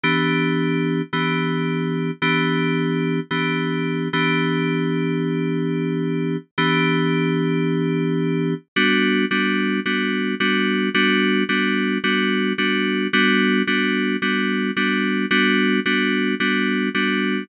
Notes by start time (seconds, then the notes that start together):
0.03 E3 B3 D4 G4
1.13 E3 B3 D4 G4
2.22 E3 B3 D4 G4
3.31 E3 B3 D4 G4
4.13 E3 B3 D4 G4
6.58 E3 B3 D4 G4
8.76 G3 B3 D4 F#4
9.31 G3 B3 D4 F#4
9.86 G3 B3 D4 F#4
10.40 G3 B3 D4 F#4
10.94 G3 B3 D4 F#4
11.49 G3 B3 D4 F#4
12.04 G3 B3 D4 F#4
12.58 G3 B3 D4 F#4
13.13 G3 B3 D4 F#4
13.67 G3 B3 D4 F#4
14.22 G3 B3 D4 F#4
14.76 G3 B3 D4 F#4
15.31 G3 B3 D4 F#4
15.86 G3 B3 D4 F#4
16.40 G3 B3 D4 F#4
16.94 G3 B3 D4 F#4